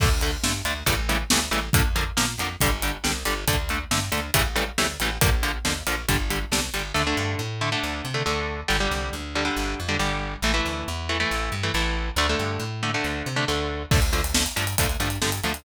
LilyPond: <<
  \new Staff \with { instrumentName = "Overdriven Guitar" } { \time 4/4 \key d \minor \tempo 4 = 138 <d a>8 <d a>8 <d a>8 <d a>8 <cis e g a>8 <cis e g a>8 <cis e g a>8 <cis e g a>8 | <d f bes>8 <d f bes>8 <d f bes>8 <d f bes>8 <d g>8 <d g>8 <d g>8 <d g>8 | <d a>8 <d a>8 <d a>8 <d a>8 <cis e g a>8 <cis e g a>8 <cis e g a>8 <cis e g a>8 | <d f bes>8 <d f bes>8 <d f bes>8 <d f bes>8 <d g>8 <d g>8 <d g>8 <d g>8 |
<d a>16 <d a>4~ <d a>16 <d a>16 <d a>4 <d a>16 <d a>4 | <d g>16 <d g>4~ <d g>16 <d g>16 <d g>4 <d g>16 <d g>4 | <e a>16 <e a>4~ <e a>16 <e a>16 <e a>4 <e a>16 <e a>4 | <d a>16 <d a>4~ <d a>16 <d a>16 <d a>4 <d a>16 <d a>4 |
\key f \major <d f a>8 <d f a>8 <d f a>8 <d f a>8 <d f a>8 <d f a>8 <d f a>8 <d f a>8 | }
  \new Staff \with { instrumentName = "Electric Bass (finger)" } { \clef bass \time 4/4 \key d \minor d,4 g,8 d,8 a,,4 d,8 a,,8 | f,4 bes,8 f,8 g,,4 c,8 g,,8 | d,4 g,8 d,8 a,,4 d,8 a,,8 | bes,,4 ees,8 bes,,8 g,,4 c,8 g,,8 |
d,8 g,8 a,4 d,8 c8 d,4 | g,,8 c,8 d,4 g,,8 f,8 g,,4 | a,,8 d,8 e,4 a,,8 g,8 a,,4 | d,8 g,8 a,4 d,8 c8 d,4 |
\key f \major d,4. g,8 d,8 g,8 g,8 d,8 | }
  \new DrumStaff \with { instrumentName = "Drums" } \drummode { \time 4/4 <cymc bd>8 hh8 sn8 hh8 <hh bd>8 hh8 sn8 hh8 | <hh bd>8 hh8 sn8 hh8 <hh bd>8 hh8 sn8 hh8 | <hh bd>8 hh8 sn8 hh8 <hh bd>8 hh8 sn8 hh8 | <hh bd>8 hh8 sn8 hh8 <hh bd>8 hh8 sn8 hh8 |
r4 r4 r4 r4 | r4 r4 r4 r4 | r4 r4 r4 r4 | r4 r4 r4 r4 |
<cymc bd>16 hh16 hh16 hh16 sn16 hh16 hh16 hh16 <hh bd>16 hh16 hh16 hh16 sn16 hh16 hh16 hh16 | }
>>